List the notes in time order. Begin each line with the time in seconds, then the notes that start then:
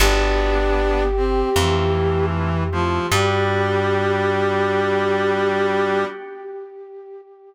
0.00 G1 B3 D4 F#4 G4
1.16 C4
1.55 F2 E3 A3 C4 E4 F4
1.95 A3 C4 E4 F4
2.72 F3 A3 C4 E4 F4
3.11 G2 G3 B3 D4 F#4 G4